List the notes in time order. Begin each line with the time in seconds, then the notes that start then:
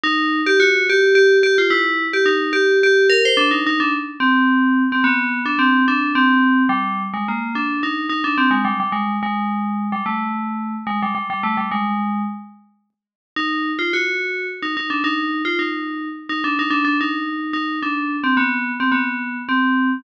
0.04 D#4
0.47 G4
0.60 F#4
0.90 G4
1.15 G4
1.43 G4
1.58 F4
1.70 E4
2.13 G4
2.26 D#4
2.53 G4
2.83 G4
3.10 A#4
3.25 C5
3.37 D4
3.51 D#4
3.67 D#4
3.80 D4
4.20 C4
4.92 C4
5.04 B3
5.46 D4
5.59 C4
5.88 D4
6.15 C4
6.69 G3
7.14 G#3
7.28 A#3
7.55 D4
7.83 D#4
8.09 D#4
8.24 D4
8.38 C4
8.51 G#3
8.65 G3
8.80 G3
8.92 G#3
9.23 G#3
9.92 G3
10.06 A3
10.87 G#3
11.03 G3
11.15 G3
11.30 G3
11.43 A3
11.57 G3
11.72 G#3
13.36 D#4
13.79 F4
13.93 F#4
14.63 D#4
14.77 D#4
14.90 D4
15.04 D#4
15.45 F4
15.59 D#4
16.29 D#4
16.44 D4
16.59 D#4
16.70 D4
16.85 D4
17.01 D#4
17.53 D#4
17.83 D4
18.24 C4
18.37 B3
18.80 C4
18.92 B3
19.49 C4